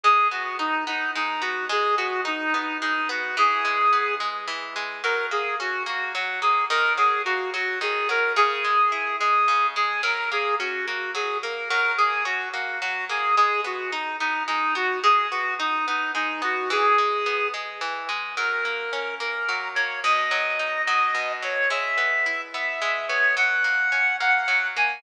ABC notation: X:1
M:6/8
L:1/8
Q:3/8=72
K:F#mix
V:1 name="Clarinet"
G F D D D F | G F D D D F | G3 z3 | A G F F F G |
A G F F G A | G3 G2 G | A G F F G A | A G F F F G |
G F D D D F | G F D D D F | G3 z3 | A3 A2 c |
d3 d2 c | e3 e2 c | f3 f2 g |]
V:2 name="Orchestral Harp"
G, B, D B, G, B, | G, B, D B, G, B, | E, G, B, G, E, G, | F, A, C A, F, A, |
D, F, A, F, D, F, | C, G, E G, C, G, | F, A, C A, F, A, | F, A, C A, F, A, |
G, B, D B, G, B, | G, B, D B, G, B, | E, G, B, G, E, G, | F, A, C A, F, A, |
B,, F, D F, B,, F, | G, B, E B, G, B, | F, A, C A, F, A, |]